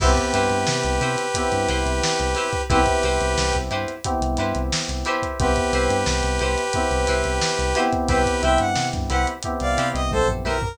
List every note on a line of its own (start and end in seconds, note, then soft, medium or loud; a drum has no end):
0.00 0.15 C2 medium
0.00 1.21 B3 medium
0.00 1.21 C4 medium
0.00 0.12 E4 loud
0.00 1.21 E4 medium
0.00 2.62 G4 medium
0.00 1.21 G4 medium
0.00 0.12 G4 medium
0.00 2.62 B4 medium
0.00 0.12 B4 medium
0.00 0.12 C5 medium
0.00 kick loud
0.00 crash loud
0.16 kick medium
0.16 snare soft
0.16 closed hi-hat medium
0.34 0.49 G2 medium
0.34 0.57 E4 medium
0.34 0.57 G4 medium
0.34 0.57 B4 medium
0.34 0.57 C5 medium
0.34 closed hi-hat medium
0.50 0.65 G2 medium
0.50 closed hi-hat medium
0.67 0.83 C3 medium
0.67 snare loud
0.83 1.00 C2 medium
0.83 closed hi-hat medium
1.01 1.16 C3 medium
1.01 1.25 E4 medium
1.01 1.25 G4 medium
1.01 1.25 B4 medium
1.01 1.25 C5 medium
1.01 closed hi-hat medium
1.17 snare soft
1.17 closed hi-hat medium
1.34 2.56 B3 medium
1.34 2.56 C4 medium
1.34 2.56 E4 medium
1.34 2.56 G4 medium
1.34 kick medium
1.34 closed hi-hat loud
1.52 1.67 G2 medium
1.52 snare soft
1.52 closed hi-hat medium
1.68 1.84 C2 medium
1.68 1.92 E4 medium
1.68 1.92 G4 medium
1.68 1.92 B4 medium
1.68 1.92 C5 medium
1.68 closed hi-hat medium
1.85 2.01 C2 medium
1.85 closed hi-hat medium
2.03 snare loud
2.19 2.35 C2 medium
2.19 closed hi-hat medium
2.35 2.48 E4 medium
2.35 2.48 G4 medium
2.35 2.48 B4 medium
2.35 2.48 C5 medium
2.35 snare soft
2.35 closed hi-hat medium
2.53 kick medium
2.53 closed hi-hat medium
2.70 2.85 C2 medium
2.70 3.91 B3 medium
2.70 3.91 C4 medium
2.70 2.81 E4 loud
2.70 3.91 E4 loud
2.70 3.91 G4 medium
2.70 3.56 G4 medium
2.70 2.81 G4 loud
2.70 3.56 B4 medium
2.70 2.81 B4 medium
2.70 2.81 C5 loud
2.70 kick loud
2.70 closed hi-hat medium
2.86 kick medium
2.86 closed hi-hat medium
3.03 3.19 C2 medium
3.03 3.27 E4 medium
3.03 3.27 G4 medium
3.03 3.27 B4 medium
3.03 3.27 C5 medium
3.03 closed hi-hat medium
3.21 3.36 C2 medium
3.21 closed hi-hat medium
3.37 3.52 C2 medium
3.37 snare loud
3.53 3.70 C2 medium
3.53 kick medium
3.53 snare soft
3.53 closed hi-hat medium
3.71 3.86 G2 medium
3.71 3.94 E4 medium
3.71 3.94 G4 medium
3.71 3.94 B4 medium
3.71 3.94 C5 medium
3.71 closed hi-hat medium
3.88 closed hi-hat medium
4.04 5.26 B3 medium
4.04 5.26 C4 medium
4.04 5.26 E4 medium
4.04 5.26 G4 medium
4.04 kick medium
4.04 closed hi-hat loud
4.21 4.36 C2 medium
4.21 closed hi-hat medium
4.37 4.53 G2 medium
4.37 4.62 E4 medium
4.37 4.62 G4 medium
4.37 4.62 B4 medium
4.37 4.62 C5 medium
4.37 snare soft
4.37 closed hi-hat medium
4.55 4.71 C2 medium
4.55 closed hi-hat medium
4.72 snare loud
4.88 5.04 C2 medium
4.88 closed hi-hat medium
5.05 5.51 E4 loud
5.05 5.51 G4 loud
5.05 5.51 B4 medium
5.05 5.51 C5 loud
5.05 closed hi-hat medium
5.22 kick medium
5.22 closed hi-hat medium
5.39 5.55 C2 medium
5.39 6.61 B3 medium
5.39 6.61 C4 medium
5.39 6.61 E4 medium
5.39 6.61 G4 medium
5.39 7.80 G4 medium
5.39 7.80 B4 medium
5.39 kick loud
5.39 closed hi-hat loud
5.56 kick medium
5.56 closed hi-hat medium
5.73 5.88 C2 medium
5.73 5.97 E4 medium
5.73 5.97 G4 medium
5.73 5.97 B4 medium
5.73 5.97 C5 medium
5.73 closed hi-hat medium
5.90 6.05 G2 medium
5.90 closed hi-hat medium
6.06 6.22 C2 medium
6.06 snare loud
6.23 6.39 C2 medium
6.23 snare soft
6.23 closed hi-hat medium
6.39 6.56 C2 medium
6.39 6.64 E4 medium
6.39 6.64 G4 medium
6.39 6.64 B4 medium
6.39 6.64 C5 medium
6.39 closed hi-hat medium
6.58 closed hi-hat medium
6.73 7.70 B3 medium
6.73 7.70 C4 medium
6.73 7.70 E4 medium
6.73 7.70 G4 medium
6.73 kick medium
6.73 closed hi-hat loud
6.91 7.06 C2 medium
6.91 closed hi-hat medium
7.07 7.23 C2 medium
7.07 7.31 E4 medium
7.07 7.31 G4 medium
7.07 7.31 B4 medium
7.07 7.31 C5 medium
7.07 closed hi-hat medium
7.24 7.39 C2 medium
7.24 closed hi-hat medium
7.41 snare loud
7.59 7.74 C2 medium
7.59 closed hi-hat medium
7.75 9.30 B3 loud
7.75 9.30 C4 medium
7.75 7.87 E4 medium
7.75 9.30 E4 medium
7.75 9.30 G4 loud
7.75 7.87 G4 medium
7.75 7.87 B4 medium
7.75 7.87 C5 medium
7.75 snare soft
7.75 closed hi-hat medium
7.93 kick medium
7.93 closed hi-hat medium
8.08 8.24 C2 medium
8.08 8.21 E4 loud
8.08 8.42 G4 medium
8.08 8.21 G4 loud
8.08 8.42 B4 medium
8.08 8.21 B4 medium
8.08 8.21 C5 loud
8.08 kick loud
8.08 closed hi-hat medium
8.26 kick medium
8.26 closed hi-hat medium
8.43 8.58 C2 medium
8.43 8.66 E4 medium
8.43 8.66 G4 medium
8.43 8.66 B4 medium
8.43 8.66 C5 medium
8.43 8.59 E5 medium
8.43 8.59 G5 medium
8.43 closed hi-hat medium
8.58 8.75 G2 medium
8.58 8.87 F#5 medium
8.58 closed hi-hat medium
8.76 8.92 C3 medium
8.76 snare loud
8.93 9.09 G2 medium
8.93 kick loud
8.93 closed hi-hat medium
9.10 9.26 C2 medium
9.10 9.34 E4 medium
9.10 9.34 G4 medium
9.10 9.34 B4 medium
9.10 9.34 C5 medium
9.10 9.26 F#5 medium
9.10 closed hi-hat medium
9.27 closed hi-hat medium
9.43 10.65 B3 medium
9.43 10.65 C4 medium
9.43 10.65 E4 medium
9.43 10.65 G4 medium
9.43 kick medium
9.43 closed hi-hat loud
9.60 9.76 C2 medium
9.60 9.88 D5 medium
9.60 9.88 F5 medium
9.60 closed hi-hat medium
9.78 9.93 C3 medium
9.78 10.01 E4 medium
9.78 10.01 G4 medium
9.78 10.01 B4 medium
9.78 10.01 C5 medium
9.78 closed hi-hat medium
9.94 10.10 C2 medium
9.94 10.10 D#5 medium
9.94 closed hi-hat medium
10.11 10.42 A#1 medium
10.11 10.28 A4 medium
10.11 10.28 C5 medium
10.11 kick medium
10.11 high tom medium
10.28 floor tom medium
10.44 10.75 B1 medium
10.44 10.57 E4 medium
10.44 10.57 G4 medium
10.44 10.61 A#4 medium
10.44 10.57 B4 medium
10.44 10.57 C5 medium
10.44 high tom medium
10.62 10.77 A#4 medium
10.62 floor tom loud